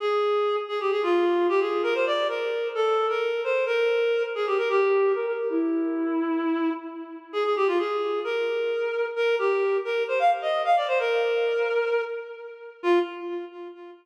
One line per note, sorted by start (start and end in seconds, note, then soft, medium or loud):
0.00 0.56 G#4 medium
0.69 0.79 G#4 medium
0.80 0.91 G4 medium
0.91 1.02 G#4 medium
1.03 1.47 F4 medium
1.49 1.60 G4 medium
1.60 1.82 G#4 medium
1.83 1.94 A#4 medium
1.94 2.05 C5 medium
2.06 2.27 D5 medium
2.29 2.68 A#4 medium
2.75 3.07 A4 medium
3.09 3.42 A#4 medium
3.44 3.65 C5 medium
3.66 4.23 A#4 medium
4.35 4.46 G#4 medium
4.47 4.57 G4 medium
4.58 4.69 A#4 medium
4.69 5.12 G4 medium
5.15 5.26 A#4 medium
5.27 5.48 A#4 medium
5.50 6.70 E4 medium
7.33 7.44 G#4 medium
7.44 7.55 G#4 medium
7.56 7.67 G4 medium
7.67 7.78 F4 medium
7.79 8.20 G#4 medium
8.24 9.06 A#4 medium
9.16 9.35 A#4 medium
9.39 9.77 G4 medium
9.85 10.03 A#4 medium
10.08 10.19 C5 medium
10.19 10.30 F5 medium
10.42 10.62 D#5 medium
10.65 10.76 F5 medium
10.76 10.87 D5 medium
10.88 10.98 C5 medium
11.00 12.02 A#4 medium
12.83 12.99 F4 loud